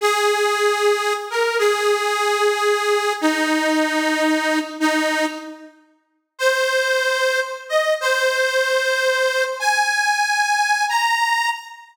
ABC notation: X:1
M:4/4
L:1/8
Q:"Swing" 1/4=75
K:Ab
V:1 name="Harmonica"
A3 B A4 | E4 E z3 | c3 e c4 | a3 b2 z3 |]